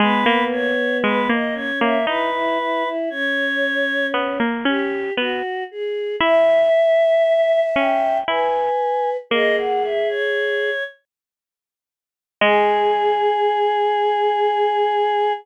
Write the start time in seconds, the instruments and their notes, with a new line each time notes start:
0.00 harpsichord G#3, choir aahs B3 B4
0.26 harpsichord A#3
0.52 choir aahs C#5
1.03 harpsichord G#3, choir aahs B4
1.30 harpsichord A#3, choir aahs D#5
1.53 choir aahs C#4 C#5
1.81 harpsichord A#3, choir aahs E5
2.05 harpsichord D#4, choir aahs E4 B4
2.33 choir aahs E4
2.59 choir aahs E4
2.85 choir aahs E4
3.10 choir aahs C#4 C#5
4.14 harpsichord B3
4.40 harpsichord A#3
4.65 harpsichord C#4, choir aahs G4
5.17 harpsichord B3, choir aahs F#4
5.71 choir aahs G#4
6.20 harpsichord E4, choir aahs E5
7.76 harpsichord C#4, choir aahs G5
8.27 harpsichord E4, choir aahs B4 G#5
9.30 harpsichord A#3, choir aahs G#4 D#5
9.58 choir aahs F#5
9.84 choir aahs E5
10.09 choir aahs C#5
12.41 harpsichord G#3, choir aahs G#4